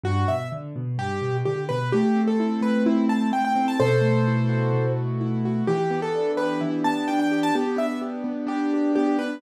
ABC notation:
X:1
M:4/4
L:1/16
Q:1/4=128
K:Em
V:1 name="Acoustic Grand Piano"
F2 e2 z4 G4 G2 B2 | G3 A3 B2 E2 a2 g g2 a | [Ac]10 z6 | G3 A3 B2 E2 a2 g g2 a |
G2 e2 z4 G4 G2 B2 |]
V:2 name="Acoustic Grand Piano"
G,,2 B,,2 D,2 B,,2 G,,2 B,,2 D,2 B,,2 | A,2 C2 E2 A,2 C2 E2 A,2 C2 | B,,2 A,2 E2 F2 B,,2 A,2 E2 F2 | E,2 B,2 D2 G2 E,2 B,2 D2 G2 |
B,2 D2 G2 B,2 D2 G2 B,2 D2 |]